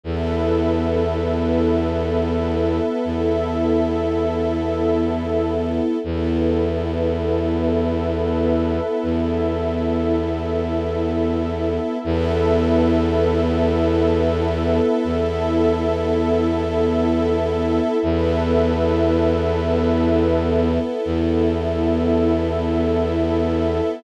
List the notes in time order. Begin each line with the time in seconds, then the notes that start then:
0.03 E2 B3 E4 A4 B4 E5
3.04 E2 E4 A4 E5
6.04 E2 B3 E4 A4 B4 E5
9.03 E2 E4 A4 E5
12.03 E2 B3 E4 A4 B4 E5
15.04 E2 E4 A4 E5
18.03 E2 B3 E4 A4 B4 E5
21.04 E2 E4 A4 E5